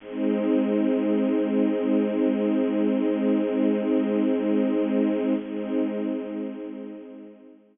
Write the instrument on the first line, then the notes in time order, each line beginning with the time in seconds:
string ensemble 1
0.00 G#3 C4 D#4
5.39 G#3 C4 D#4